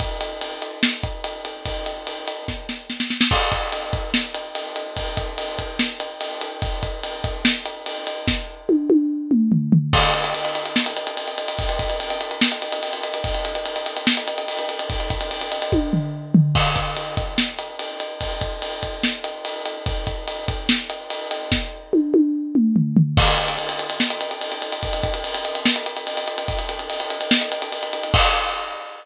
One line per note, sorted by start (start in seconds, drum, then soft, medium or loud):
0.00 kick medium
0.00 ride medium
0.21 ride medium
0.41 ride medium
0.62 ride medium
0.83 snare loud
1.03 kick medium
1.03 ride medium
1.24 ride medium
1.45 ride medium
1.66 kick medium
1.66 ride medium
1.86 ride medium
2.07 ride medium
2.28 ride medium
2.48 kick medium
2.48 snare medium
2.69 snare medium
2.90 snare medium
3.00 snare medium
3.10 snare medium
3.21 snare loud
3.31 kick medium
3.31 crash medium
3.52 kick medium
3.52 ride medium
3.72 ride medium
3.93 kick medium
3.93 ride medium
4.14 snare medium
4.34 ride medium
4.55 ride medium
4.76 ride medium
4.97 kick medium
4.97 ride loud
5.17 kick medium
5.17 ride medium
5.38 ride loud
5.59 kick medium
5.59 ride medium
5.79 snare medium
6.00 ride medium
6.21 ride medium
6.41 ride medium
6.62 kick loud
6.62 ride medium
6.83 kick medium
6.83 ride medium
7.03 ride medium
7.24 kick medium
7.24 ride medium
7.45 snare loud
7.66 ride medium
7.86 ride medium
8.07 ride medium
8.28 kick medium
8.28 snare medium
8.69 high tom medium
8.90 high tom medium
9.31 mid tom medium
9.52 floor tom medium
9.72 floor tom loud
9.93 kick medium
9.93 crash loud
10.03 ride medium
10.14 ride medium
10.24 ride medium
10.34 ride loud
10.45 ride medium
10.55 ride medium
10.66 ride medium
10.76 snare medium
10.86 ride medium
10.97 ride medium
11.07 ride medium
11.17 ride medium
11.28 ride medium
11.38 ride medium
11.48 ride medium
11.59 kick loud
11.59 ride loud
11.69 ride medium
11.79 kick medium
11.79 ride medium
11.90 ride medium
12.00 ride loud
12.10 ride medium
12.21 ride medium
12.31 ride medium
12.41 snare loud
12.52 ride medium
12.62 ride medium
12.72 ride medium
12.83 ride loud
12.93 ride medium
13.03 ride medium
13.14 ride medium
13.24 kick loud
13.24 ride loud
13.34 ride medium
13.45 ride medium
13.55 ride medium
13.66 ride medium
13.76 ride medium
13.86 ride medium
13.97 ride medium
14.07 snare loud
14.17 ride medium
14.28 ride medium
14.38 ride medium
14.48 ride loud
14.59 ride medium
14.69 ride medium
14.79 ride medium
14.90 kick loud
14.90 ride loud
15.00 ride medium
15.10 kick medium
15.10 ride medium
15.21 ride medium
15.31 ride loud
15.41 ride medium
15.52 ride medium
15.62 ride medium
15.72 kick medium
15.72 high tom medium
15.93 floor tom medium
16.34 floor tom loud
16.55 kick medium
16.55 crash medium
16.76 kick medium
16.76 ride medium
16.97 ride medium
17.17 kick medium
17.17 ride medium
17.38 snare medium
17.59 ride medium
17.79 ride medium
18.00 ride medium
18.21 kick medium
18.21 ride loud
18.41 kick medium
18.41 ride medium
18.62 ride loud
18.83 kick medium
18.83 ride medium
19.03 snare medium
19.24 ride medium
19.45 ride medium
19.66 ride medium
19.86 kick loud
19.86 ride medium
20.07 kick medium
20.07 ride medium
20.28 ride medium
20.48 kick medium
20.48 ride medium
20.69 snare loud
20.90 ride medium
21.10 ride medium
21.31 ride medium
21.52 kick medium
21.52 snare medium
21.93 high tom medium
22.14 high tom medium
22.55 mid tom medium
22.76 floor tom medium
22.97 floor tom loud
23.17 kick loud
23.17 crash loud
23.28 ride medium
23.38 ride medium
23.48 ride medium
23.59 ride medium
23.69 ride medium
23.79 ride medium
23.90 ride medium
24.00 snare medium
24.10 ride medium
24.21 ride medium
24.31 ride medium
24.41 ride loud
24.52 ride medium
24.62 ride medium
24.72 ride medium
24.83 kick medium
24.83 ride medium
24.93 ride medium
25.03 kick medium
25.03 ride medium
25.14 ride medium
25.24 ride loud
25.34 ride medium
25.45 ride medium
25.55 ride medium
25.66 snare loud
25.76 ride medium
25.86 ride medium
25.97 ride medium
26.07 ride medium
26.17 ride medium
26.28 ride medium
26.38 ride medium
26.48 kick medium
26.48 ride medium
26.59 ride medium
26.69 ride medium
26.79 ride medium
26.90 ride loud
27.00 ride medium
27.10 ride medium
27.21 ride medium
27.31 snare loud
27.41 ride medium
27.52 ride medium
27.62 ride medium
27.72 ride medium
27.83 ride medium
27.93 ride medium
28.03 ride medium
28.14 kick loud
28.14 crash loud